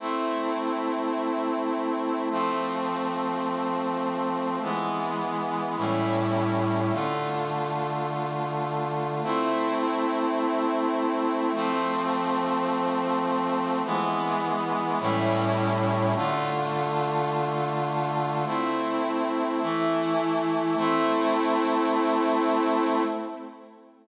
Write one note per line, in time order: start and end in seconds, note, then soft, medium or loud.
0.00 2.29 A3 medium
0.00 2.29 C4 medium
0.00 2.29 E4 medium
2.31 4.59 F3 medium
2.31 4.59 A3 medium
2.31 4.59 C4 medium
4.62 5.76 E3 medium
4.62 5.76 G#3 medium
4.62 5.76 B3 medium
5.77 6.91 A2 medium
5.77 6.91 G3 medium
5.77 6.91 C#4 medium
5.77 6.91 E4 medium
6.92 9.21 D3 medium
6.92 9.21 A3 medium
6.92 9.21 F4 medium
9.23 11.52 A3 medium
9.23 11.52 C4 medium
9.23 11.52 E4 medium
11.54 13.82 F3 medium
11.54 13.82 A3 medium
11.54 13.82 C4 loud
13.85 14.99 E3 medium
13.85 14.99 G#3 medium
13.85 14.99 B3 loud
15.00 16.14 A2 loud
15.00 16.14 G3 medium
15.00 16.14 C#4 medium
15.00 16.14 E4 medium
16.15 18.44 D3 medium
16.15 18.44 A3 medium
16.15 18.44 F4 medium
18.46 19.60 A3 medium
18.46 19.60 C4 medium
18.46 19.60 E4 medium
19.62 20.76 E3 medium
19.62 20.76 A3 medium
19.62 20.76 E4 medium
20.77 23.03 A3 loud
20.77 23.03 C4 medium
20.77 23.03 E4 loud